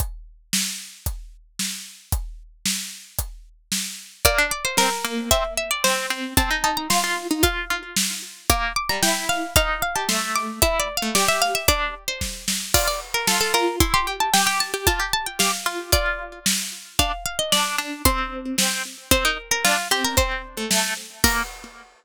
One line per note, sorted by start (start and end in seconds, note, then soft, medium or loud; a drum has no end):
0.00 kick loud
0.00 closed hi-hat medium
0.53 snare loud
1.06 kick loud
1.06 closed hi-hat medium
1.59 snare loud
2.12 kick loud
2.12 closed hi-hat loud
2.65 snare loud
3.19 kick medium
3.19 closed hi-hat loud
3.72 snare loud
4.25 4.38 A#3 medium
4.25 4.47 D5 medium
4.25 kick loud
4.25 closed hi-hat loud
4.38 4.51 D4 medium
4.51 4.64 D5 medium
4.65 4.77 C5 medium
4.77 4.90 C4 medium
4.77 5.29 A#4 medium
4.77 snare loud
5.05 5.30 A#3 medium
5.31 5.43 C4 medium
5.31 5.54 E5 medium
5.31 kick loud
5.31 closed hi-hat loud
5.57 5.70 E5 medium
5.71 5.83 D5 medium
5.84 6.06 C4 medium
5.84 6.32 C5 medium
5.84 snare loud
6.10 6.34 C4 medium
6.37 6.50 C4 medium
6.37 6.63 A5 medium
6.37 kick loud
6.37 closed hi-hat loud
6.51 6.63 D#4 medium
6.64 6.88 D#4 medium
6.64 6.76 A5 medium
6.77 6.90 A#5 medium
6.90 7.02 F4 medium
6.90 7.40 C6 medium
6.90 snare loud
7.04 7.27 F4 medium
7.31 7.43 D#4 medium
7.43 7.65 F4 medium
7.43 8.11 F5 medium
7.43 kick loud
7.43 closed hi-hat loud
7.70 7.95 F4 medium
7.96 snare loud
8.50 8.73 A#3 medium
8.50 8.73 D6 medium
8.50 kick loud
8.50 closed hi-hat loud
8.76 8.89 D6 medium
8.89 9.02 G3 medium
8.89 9.02 A#5 medium
9.03 9.46 E4 medium
9.03 9.25 G5 medium
9.03 snare loud
9.29 9.54 F5 medium
9.56 9.82 D#4 medium
9.56 9.80 F5 medium
9.56 kick loud
9.56 closed hi-hat loud
9.82 9.95 F5 medium
9.95 10.08 G4 medium
9.95 10.08 A5 medium
10.09 10.60 A3 medium
10.09 10.33 C6 medium
10.09 snare loud
10.36 10.59 D6 medium
10.62 10.88 E4 medium
10.62 10.79 E5 medium
10.62 kick loud
10.62 closed hi-hat loud
10.80 10.96 D5 medium
10.97 11.14 F5 medium
11.02 11.15 A3 medium
11.15 11.62 G4 medium
11.15 11.28 D5 medium
11.15 snare loud
11.28 11.41 E5 medium
11.42 11.54 F5 medium
11.55 11.67 E5 medium
11.68 11.94 D4 medium
11.68 12.04 D5 medium
11.68 kick loud
11.68 closed hi-hat loud
12.08 12.45 C5 medium
12.21 kick medium
12.21 snare medium
12.48 snare loud
12.74 12.87 F4 medium
12.74 12.87 D5 medium
12.74 kick loud
12.74 crash loud
12.87 13.00 D5 medium
13.14 13.27 A#4 medium
13.27 13.53 F4 medium
13.27 13.40 A4 medium
13.27 snare loud
13.41 13.53 A4 medium
13.54 13.79 F4 medium
13.54 13.76 A#4 medium
13.80 13.93 E4 medium
13.80 13.93 C6 medium
13.80 kick loud
13.80 closed hi-hat loud
13.94 14.06 G4 medium
13.94 14.06 C6 medium
14.07 14.30 G4 medium
14.20 14.33 A5 medium
14.34 14.46 G4 medium
14.34 14.46 G5 medium
14.34 snare loud
14.46 14.72 G4 medium
14.46 14.59 G5 medium
14.60 14.86 A5 medium
14.74 14.86 G4 medium
14.87 15.00 F4 medium
14.87 15.10 A5 medium
14.87 kick loud
14.87 closed hi-hat loud
15.00 15.12 G4 medium
15.13 15.26 A5 medium
15.26 15.39 G5 medium
15.39 15.52 G4 medium
15.39 15.84 F5 medium
15.39 snare loud
15.66 15.91 F4 medium
15.92 16.39 F4 medium
15.92 16.70 D5 medium
15.92 kick loud
15.92 closed hi-hat loud
16.46 snare loud
16.99 17.12 D4 medium
16.99 17.24 F5 medium
16.99 kick loud
16.99 closed hi-hat loud
17.26 17.38 F5 medium
17.39 17.52 D#5 medium
17.52 17.76 D4 medium
17.52 17.97 D5 medium
17.52 snare loud
17.78 18.02 D4 medium
18.05 18.56 C4 medium
18.05 18.74 C6 medium
18.05 kick loud
18.05 closed hi-hat loud
18.58 18.83 C4 medium
18.58 snare loud
19.11 19.24 C4 medium
19.11 19.24 C5 medium
19.11 kick loud
19.11 closed hi-hat loud
19.25 19.37 D#4 medium
19.25 19.50 A#4 medium
19.51 19.64 A#4 medium
19.64 19.77 D4 medium
19.64 19.88 F4 medium
19.64 snare loud
19.91 20.15 C4 medium
19.91 20.04 G4 medium
20.04 20.17 A#4 medium
20.17 20.42 C4 medium
20.17 20.65 C5 medium
20.17 kick loud
20.17 closed hi-hat medium
20.57 20.70 A3 medium
20.71 20.94 A3 medium
20.71 snare loud
21.24 21.43 A#3 loud
21.24 21.42 A#4 loud
21.24 kick loud
21.24 crash loud